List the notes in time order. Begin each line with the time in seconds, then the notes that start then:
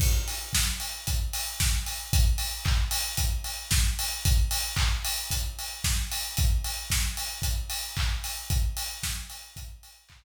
0.00 kick, crash
0.28 open hi-hat
0.53 kick, snare
0.80 open hi-hat
1.07 kick, closed hi-hat
1.33 open hi-hat
1.60 kick, snare
1.86 open hi-hat
2.13 kick, closed hi-hat
2.38 open hi-hat
2.65 kick, clap
2.91 open hi-hat
3.17 kick, closed hi-hat
3.44 open hi-hat
3.71 kick, snare
3.99 open hi-hat
4.25 kick, closed hi-hat
4.51 open hi-hat
4.76 kick, clap
5.05 open hi-hat
5.31 kick, closed hi-hat
5.59 open hi-hat
5.84 kick, snare
6.12 open hi-hat
6.37 kick, closed hi-hat
6.64 open hi-hat
6.90 kick, snare
7.17 open hi-hat
7.42 kick, closed hi-hat
7.70 open hi-hat
7.97 kick, clap
8.24 open hi-hat
8.50 kick, closed hi-hat
8.77 open hi-hat
9.03 kick, snare
9.30 open hi-hat
9.56 kick, closed hi-hat
9.83 open hi-hat
10.09 kick, clap